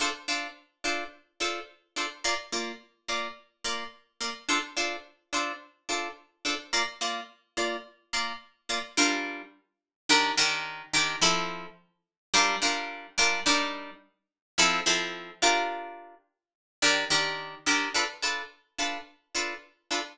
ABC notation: X:1
M:4/4
L:1/8
Q:1/4=107
K:Dm
V:1 name="Acoustic Guitar (steel)"
[DFAc] [DFAc]2 [DFAc]2 [DFAc]2 [DFAc] | [B,Fd] [B,Fd]2 [B,Fd]2 [B,Fd]2 [B,Fd] | [DFAc] [DFAc]2 [DFAc]2 [DFAc]2 [DFAc] | [B,Fd] [B,Fd]2 [B,Fd]2 [B,Fd]2 [B,Fd] |
[K:Gm] [G,DFB]4 [E,DGB] [E,DGB]2 [E,DGB] | [F,C=EA]4 [G,DFB] [G,DFB]2 [G,DFB] | [G,DEB]4 [F,C=EA] [F,CEA]2 [DFGB]- | [DFGB]4 [E,DGB] [E,DGB]2 [E,DGB] |
[K:Dm] [DFA=B] [DFAB]2 [DFAB]2 [DFAB]2 [DFAB] |]